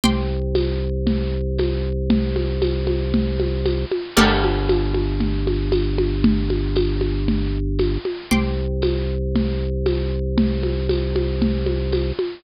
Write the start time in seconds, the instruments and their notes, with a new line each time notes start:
0.04 drawbar organ C2, pizzicato strings G5 C6 D6, low conga
0.55 tambourine, high conga
1.07 low conga
1.58 tambourine, high conga
2.10 low conga
2.36 high conga
2.62 tambourine, high conga
2.87 high conga
3.14 low conga
3.40 high conga
3.66 tambourine, high conga
3.91 high conga
4.16 drawbar organ G1, pizzicato strings G4 A4 A#4 D5, crash, low conga
4.44 high conga
4.69 tambourine, high conga
4.94 high conga
5.20 low conga
5.47 high conga
5.72 tambourine, high conga
5.98 high conga
6.24 low conga
6.50 high conga
6.76 tambourine, high conga
7.01 high conga
7.28 low conga
7.79 tambourine, high conga
8.05 high conga
8.31 drawbar organ C2, pizzicato strings G5 C6 D6, low conga
8.82 tambourine, high conga
9.35 low conga
9.86 tambourine, high conga
10.38 low conga
10.63 high conga
10.89 tambourine, high conga
11.16 high conga
11.42 low conga
11.66 high conga
11.92 tambourine, high conga
12.19 high conga